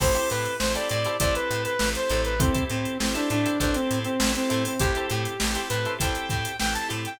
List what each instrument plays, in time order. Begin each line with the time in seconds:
0.00 electric bass (finger) A1, drawbar organ C4 E4 G4 A4, pizzicato strings E4 G4 A4 C5, lead 2 (sawtooth) C5, kick, crash
0.14 pizzicato strings E4 G4 A4 C5, closed hi-hat
0.30 electric bass (finger) A2, lead 2 (sawtooth) B4, closed hi-hat
0.45 closed hi-hat
0.59 electric bass (finger) A1, drawbar organ C4 E4 G4 A4, lead 2 (sawtooth) C5, snare
0.75 pizzicato strings E4 G4 A4 C5, lead 2 (sawtooth) D5, snare, closed hi-hat
0.89 electric bass (finger) A2, lead 2 (sawtooth) D5, closed hi-hat
1.04 pizzicato strings E4 G4 A4 C5, closed hi-hat
1.20 electric bass (finger) A1, drawbar organ C4 E4 G4 A4, pizzicato strings E4 G4 A4 C5, lead 2 (sawtooth) D5, kick, closed hi-hat
1.35 lead 2 (sawtooth) B4, closed hi-hat
1.51 electric bass (finger) A2, closed hi-hat
1.64 lead 2 (sawtooth) B4, closed hi-hat
1.79 electric bass (finger) A1, drawbar organ C4 E4 G4 A4, snare
1.95 lead 2 (sawtooth) C5, closed hi-hat
2.10 electric bass (finger) A1, pizzicato strings E4 G4 A4 C5, closed hi-hat
2.25 lead 2 (sawtooth) B4, closed hi-hat
2.39 drawbar organ C4 E4 G4 A4, lead 2 (sawtooth) C4, pizzicato strings E4 G4 A4 C5, kick, closed hi-hat
2.54 pizzicato strings E4 G4 A4 C5, kick, closed hi-hat
2.69 electric bass (finger) A2, lead 2 (sawtooth) C4, closed hi-hat
2.85 closed hi-hat
3.00 electric bass (finger) A1, drawbar organ C4 E4 G4 A4, lead 2 (sawtooth) C4, snare
3.15 lead 2 (sawtooth) D4, pizzicato strings E4 G4 A4 C5, closed hi-hat
3.30 electric bass (finger) A2, lead 2 (sawtooth) D4, closed hi-hat
3.46 pizzicato strings E4 G4 A4 C5, closed hi-hat
3.60 electric bass (finger) A1, drawbar organ C4 E4 G4 A4, lead 2 (sawtooth) D4, pizzicato strings E4 G4 A4 C5, kick, closed hi-hat
3.74 lead 2 (sawtooth) C4, snare, closed hi-hat
3.91 electric bass (finger) A2, closed hi-hat
4.04 lead 2 (sawtooth) C4, closed hi-hat
4.19 electric bass (finger) A1, drawbar organ C4 E4 G4 A4, snare
4.35 lead 2 (sawtooth) C4, closed hi-hat
4.50 electric bass (finger) A2, pizzicato strings E4 G4 A4 C5, closed hi-hat
4.65 lead 2 (sawtooth) C4, open hi-hat
4.79 electric bass (finger) A1, drawbar organ C4 E4 G4 A4, pizzicato strings E4 G4 A4 C5, lead 2 (sawtooth) G4, kick, closed hi-hat
4.95 pizzicato strings E4 G4 A4 C5, closed hi-hat
5.10 electric bass (finger) A2, lead 2 (sawtooth) G4, closed hi-hat
5.25 closed hi-hat
5.40 electric bass (finger) A1, drawbar organ C4 E4 G4 A4, snare
5.55 pizzicato strings E4 G4 A4 C5, closed hi-hat
5.69 electric bass (finger) A2, lead 2 (sawtooth) B4, closed hi-hat
5.85 pizzicato strings E4 G4 A4 C5, closed hi-hat
5.98 electric bass (finger) A1, drawbar organ C4 E4 G4 A4, pizzicato strings E4 G4 A4 C5, lead 2 (sawtooth) G5, kick, closed hi-hat
6.15 closed hi-hat
6.29 electric bass (finger) A2, lead 2 (sawtooth) G5, kick, snare, closed hi-hat
6.45 closed hi-hat
6.59 electric bass (finger) A1, drawbar organ C4 E4 G4 A4, lead 2 (sawtooth) G5, snare
6.74 lead 2 (sawtooth) A5, closed hi-hat
6.89 electric bass (finger) A2, pizzicato strings E4 G4 A4 C5, closed hi-hat
7.05 lead 2 (sawtooth) G5, closed hi-hat